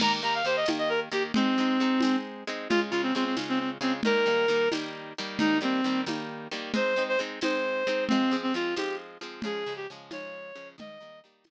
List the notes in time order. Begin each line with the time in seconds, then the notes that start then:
0.00 D#3 A#3 G4 A#5, crash, low conga
0.22 D#3 A#3 G4 A#5
0.34 F5
0.44 D#3 A#3 G4 C5
0.56 D#5
0.66 D#3 A#3 G4, tambourine, high conga
0.78 D#5
0.89 A#4
1.12 D#3 A#3 G4
1.34 G#3 C4 D#4, low conga
1.58 G#3 C4 D#4
1.80 G#3 C4 D#4
2.00 G#3 C4, tambourine, high conga
2.05 D#4
2.47 G#3 C4 D#4
2.69 C#3 G#3 F4, low conga
2.91 C#3 G#3 F4
3.03 C4
3.15 C#3 G#3 C4 F4
3.25 C4
3.37 C#3 G#3 F4, tambourine, high conga
3.49 C4
3.59 C4
3.81 C#3 G#3 C4 F4
4.03 D#3 G3 A#4, low conga
4.07 A#3
4.26 D#3 G3 A#3
4.48 D#3 G3 A#3
4.72 D#3 G3 A#3, tambourine, high conga
5.18 D#3 G3 A#3
5.39 D#3 G3 A#3 D#4, low conga
5.61 D#3 G3 A#3 C4
5.84 D#3 G3 A#3
6.06 D#3 G3 A#3, tambourine, high conga
6.51 D#3 G3 A#3
6.74 G#3 C4 D#4 C5, low conga
6.96 G#3 C4 D#4
7.08 C5
7.19 G#3 C4 D#4
7.41 G#3 C4 D#4 C5, tambourine, high conga
7.87 G#3 C4 D#4
8.08 F3 G#3 C4, low conga
8.13 C4
8.31 F3 G#3 C4
8.43 C4
8.54 F3 G#3 C4 F4
8.76 F3 G#3 C4 G4, tambourine, high conga
9.21 F3 G#3 C4
9.42 C#3 F3 G#3 G#4, low conga
9.66 C#3 F3 G#3
9.76 G4
9.90 C#3 F3 G#3
10.11 C#3 F3 G#3 C#5, tambourine, high conga
10.55 C#3 F3 G#3
10.78 D#3 G3 A#3 D#5, low conga
11.00 D#3 G3 A#3
11.24 D#3 G3 A#3
11.44 D#3 G3, tambourine, high conga
11.49 A#3